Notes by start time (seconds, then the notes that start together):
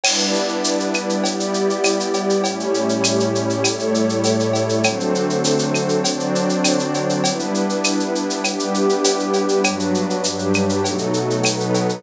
0.04 G3 B3 D4 E4 B4 D5, crash, cowbell, claves
0.20 shaker
0.34 shaker
0.48 shaker
0.64 tambourine, shaker
0.80 shaker
0.94 claves, shaker
1.09 shaker
1.24 G3 B3 E4 G4 D5, cowbell, shaker
1.40 shaker
1.54 shaker
1.70 shaker
1.84 tambourine, cowbell, claves, shaker
2.00 shaker
2.14 cowbell, shaker
2.30 shaker
2.44 A2 G3 A3 C#4 E4 G4 C#5, cowbell, shaker
2.60 shaker
2.74 shaker
2.89 shaker
3.04 tambourine, claves, shaker
3.20 shaker
3.35 shaker
3.50 shaker
3.63 A2 G3 A3 E4 A4 C#5, cowbell, claves, shaker
3.79 shaker
3.94 shaker
4.09 shaker
4.24 tambourine, cowbell, shaker
4.40 shaker
4.53 cowbell, shaker
4.69 shaker
4.83 D3 F#3 A3 C4 D4 F#4 A4 C5, cowbell, claves, shaker
5.00 shaker
5.15 shaker
5.30 shaker
5.44 tambourine, shaker
5.59 shaker
5.75 claves, shaker
5.89 shaker
6.04 D3 F#3 C4 D4 F#4 C5 D5, cowbell, shaker
6.20 shaker
6.35 shaker
6.49 shaker
6.64 tambourine, cowbell, claves, shaker
6.79 shaker
6.94 cowbell, shaker
7.09 shaker
7.23 G3 B3 D4 E4 B4, cowbell, shaker
7.40 shaker
7.54 shaker
7.69 shaker
7.84 tambourine, claves, shaker
8.00 shaker
8.15 shaker
8.30 shaker
8.44 G3 B3 D4 E4 G4 B4, cowbell, claves, shaker
8.59 shaker
8.74 shaker
8.89 shaker
9.04 tambourine, cowbell, shaker
9.19 shaker
9.33 cowbell, shaker
9.49 shaker
9.64 G2 F#3 G3 B3 D4 F#4 B4, cowbell, claves, shaker
9.79 shaker
9.94 shaker
10.10 shaker
10.24 G2 F#3 G3 D4 G4 B4, tambourine, shaker
10.39 shaker
10.54 claves, shaker
10.69 shaker
10.84 B2 F#3 A3 B3 D#4 F#4 A4, cowbell, shaker
10.98 shaker
11.14 shaker
11.30 shaker
11.44 B2 F#3 B3 D#4 A4 B4, tambourine, cowbell, claves, shaker
11.60 shaker
11.74 cowbell, shaker
11.89 shaker